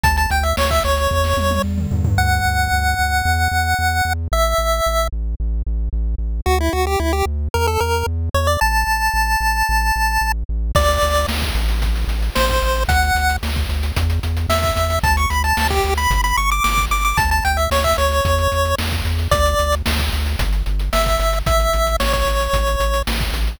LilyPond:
<<
  \new Staff \with { instrumentName = "Lead 1 (square)" } { \time 4/4 \key d \major \tempo 4 = 112 a''16 a''16 g''16 e''16 cis''16 e''16 cis''4. r4 | fis''1 | e''4. r2 r8 | fis'16 e'16 fis'16 g'16 e'16 g'16 r8 bes'16 a'16 bes'8 r8 cis''16 d''16 |
a''2.~ a''8 r8 | d''4 r2 c''4 | fis''4 r2 e''4 | a''16 cis'''16 b''16 a''8 g'8 b''8 b''16 cis'''16 d'''16 d'''8 d'''16 d'''16 |
a''16 a''16 g''16 e''16 cis''16 e''16 cis''4. r4 | d''4 r2 e''4 | e''4 cis''16 cis''4.~ cis''16 r4 | }
  \new Staff \with { instrumentName = "Synth Bass 1" } { \clef bass \time 4/4 \key d \major d,8 d,8 d,8 d,8 e,8 e,8 e,8 e,8 | d,8 d,8 d,8 d,8 e,8 e,8 e,8 e,8 | a,,8 a,,8 a,,8 a,,8 a,,8 a,,8 a,,8 a,,8 | d,8 d,8 d,8 d,8 e,8 e,8 e,8 e,8 |
a,,8 a,,8 a,,8 a,,8 a,,8 a,,8 a,,8 a,,8 | d,8 d,8 d,8 a,,4 a,,8 a,,8 a,,8 | d,8 d,8 d,8 d,8 e,8 e,8 e,8 e,8 | d,8 d,8 d,8 d,8 g,,8 g,,8 g,,8 g,,8 |
d,8 d,8 d,8 d,8 e,8 e,8 e,8 e,8 | d,8 d,8 d,8 d,8 g,,8 g,,8 g,,8 g,,8 | a,,8 a,,8 a,,8 a,,8 a,,8 a,,8 a,,8 a,,8 | }
  \new DrumStaff \with { instrumentName = "Drums" } \drummode { \time 4/4 <hh bd>16 hh16 hh16 hh16 sn16 <hh bd>16 hh16 hh16 bd16 sn16 tommh16 tommh16 r16 toml16 tomfh16 tomfh16 | r4 r4 r4 r4 | r4 r4 r4 r4 | r4 r4 r4 r4 |
r4 r4 r4 r4 | <cymc bd>16 hh16 hh16 hh16 sn16 <hh bd>16 hh16 hh16 <hh bd>16 hh16 hh16 hh16 sn16 <hh bd>16 hh16 hh16 | <hh bd>16 hh16 hh16 hh16 sn16 <hh bd>16 hh16 hh16 <hh bd>16 hh16 hh16 hh16 sn16 <hh bd>16 hh16 hh16 | <hh bd>16 hh16 hh16 hh16 sn16 <hh bd>16 hh16 hh16 <hh bd>16 hh16 hh16 hh16 sn16 <hh bd>16 hh16 hh16 |
<hh bd>16 hh16 hh16 hh16 sn16 <hh bd>16 hh16 hh16 <hh bd>16 hh16 hh16 hh16 sn16 <hh bd>16 hh16 hh16 | <hh bd>16 hh16 hh16 hh16 sn16 <hh bd>16 hh16 hh16 <hh bd>16 hh16 hh16 hh16 sn16 <hh bd>16 hh16 hh16 | <hh bd>16 hh16 hh16 hh16 sn16 <hh bd>16 hh16 hh16 <hh bd>16 hh16 hh16 hh16 sn16 <hh bd>16 hh16 hh16 | }
>>